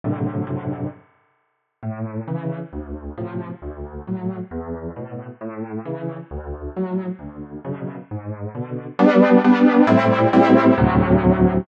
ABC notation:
X:1
M:6/8
L:1/8
Q:3/8=134
K:G
V:1 name="Acoustic Grand Piano"
[F,,A,,C,D,]3 [F,,A,,C,D,]3 | z6 | [K:A] A,,3 [C,E,]3 | D,,3 [A,,=C,=F,]3 |
D,,3 [A,,F,]3 | E,,3 [A,,B,,]3 | A,,3 [C,E,]3 | D,,3 [A,,F,]3 |
D,,3 [F,,B,,C,]3 | G,,3 [B,,D,]3 | [K:G] [G,B,D]3 [G,B,D]3 | [A,,G,CE]3 [A,,G,CE]3 |
[D,,A,,C,F,]6 |]